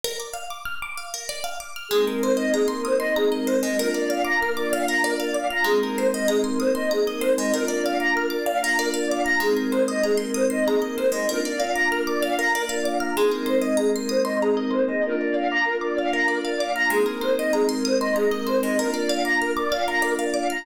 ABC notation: X:1
M:6/8
L:1/16
Q:3/8=64
K:Ablyd
V:1 name="Choir Aahs"
z12 | A B c e A B c e A B c e | B d f b B d f b B d f b | A B c e A B c e A B c e |
B d f b B d f b B d f b | A B c e A B c e A B c e | B d f b B d f b B d f b | A B c e A B c e A B c e |
B d f b B d f b B d f b | A B c e A B c e A B c e | B d f b B d f b B d f b |]
V:2 name="Pizzicato Strings"
B d f d' f' d' f B d f d' f' | A, B c e b c' e' c' b e c A, | B d f d' f' d' f B d f d' f' | A, B c e b c' e' c' b e c A, |
B d f d' f' d' f B d f d' f' | A, B c e b c' e' c' b e c A, | B d f d' f' d' f B d f d' f' | A, B c e b c' e' c' b e c A, |
B d f d' f' d' f B d f d' f' | A, B c e b c' e' c' b e c A, | B d f d' f' d' f B d f d' f' |]
V:3 name="Pad 5 (bowed)"
z12 | [A,B,CE]12 | [B,DF]12 | [A,B,CE]12 |
[B,DF]12 | [A,B,CE]12 | [B,DF]12 | [A,B,CE]12 |
[B,DF]12 | [A,B,CE]12 | [B,DF]12 |]